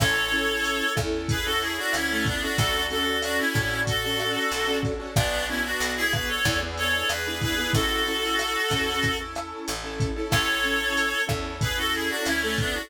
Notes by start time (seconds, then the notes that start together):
0.00 A1 C#4 E4 A4 C#5, kick, cross-stick, crash
0.32 C#4 E4 A4, closed hi-hat
0.65 closed hi-hat
0.95 E2 C#4 E4 A4, kick, cross-stick, closed hi-hat
1.29 G#4 B4, kick, closed hi-hat
1.45 C#4 E4 F#4 A4
1.61 E4 G#4, closed hi-hat
1.78 D4 F#4
1.93 D2 C#4 E4, cross-stick, closed hi-hat
2.09 A3 C#4 E4 A4
2.25 B3 D4, kick, closed hi-hat
2.42 C#4 D4 E4 F#4 A4
2.58 D2 C#4 D4 F#4 A4, kick, closed hi-hat
2.90 C#4 D4 F#4 A4, closed hi-hat
3.22 D4 F#4, cross-stick, closed hi-hat
3.38 C#4 E4
3.54 A2 C#4 D4 F#4 A4, kick, closed hi-hat
3.87 F#4 A4, kick, closed hi-hat
4.04 C#4 D4 F#4 A4
4.19 cross-stick, closed hi-hat
4.51 B1, closed hi-hat
4.67 C#4 D4 F#4 A4
4.83 kick, closed hi-hat
5.00 C#4 D4 F#4 A4
5.16 B1 B3 D4 F#4, kick, cross-stick, closed hi-hat
5.48 B3 C#4 D4 E4 F#4, closed hi-hat
5.64 D4 F#4
5.80 B1, closed hi-hat
5.96 E4 G#4
6.12 B3 D4 F#4 G#4 B4, kick, cross-stick, closed hi-hat
6.28 A4 C#5
6.45 E2 B3 D4 E4 G#4, kick, closed hi-hat
6.61 B3 D4 E4 G#4
6.77 A4 C#5, closed hi-hat
7.09 E2 G#4 B4, cross-stick, closed hi-hat
7.27 B3 D4 E4 G#4
7.41 G#4 B4, kick, closed hi-hat
7.58 B3 D4 E4 G#4
7.73 A1 C#4 E4 F#4 A4, kick, closed hi-hat
8.06 C#4 E4 A4, closed hi-hat
8.39 cross-stick, closed hi-hat
8.70 E2 C#4 E4 A4, kick, closed hi-hat
9.03 kick, closed hi-hat
9.19 C#4 E4 A4
9.35 cross-stick, closed hi-hat
9.68 A1, closed hi-hat
9.84 C#4 E4 A4
10.00 kick, closed hi-hat
10.16 C#4 E4 A4
10.31 A1 C#4 E4 A4 C#5, kick, cross-stick, crash
10.64 C#4 E4 A4, closed hi-hat
10.97 closed hi-hat
11.27 E2 C#4 E4 A4, kick, cross-stick, closed hi-hat
11.61 G#4 B4, kick, closed hi-hat
11.77 C#4 E4 F#4 A4
11.93 E4 G#4, closed hi-hat
12.09 D4 F#4
12.26 D2 C#4 E4, cross-stick, closed hi-hat
12.41 A3 C#4 E4 A4
12.58 B3 D4, kick, closed hi-hat
12.74 C#4 D4 E4 F#4 A4